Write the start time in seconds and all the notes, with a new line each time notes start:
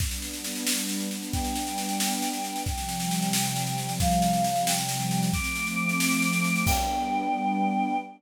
0.00 G3 B3 D4, kick, snare
0.11 snare
0.22 snare
0.33 snare
0.44 snare
0.55 snare
0.67 snare
0.78 snare
0.89 snare
1.00 snare
1.11 snare
1.22 snare
1.33 G5, kick, snare
1.45 snare
1.55 snare
1.67 snare
1.78 snare
1.89 snare
2.00 snare
2.11 snare
2.22 snare
2.33 snare
2.44 snare
2.56 snare
2.66 C3 F3 G3 G5, kick, snare
2.78 snare
2.89 snare
3.00 snare
3.11 snare
3.22 snare
3.33 snare
3.44 snare
3.56 snare
3.66 snare
3.78 snare
3.89 snare
4.00 F5, kick, snare
4.11 snare
4.22 snare
4.33 snare
4.44 snare
4.56 snare
4.67 G5, snare
4.78 snare
4.89 snare
5.00 snare
5.11 snare
5.23 snare
5.33 F3 A3 C4 D6, kick, snare
5.44 snare
5.56 snare
5.67 snare
5.78 snare
5.89 snare
6.00 snare
6.11 snare
6.22 snare
6.33 snare
6.44 snare
6.56 snare
6.67 G3 B3 D4 G5, kick, crash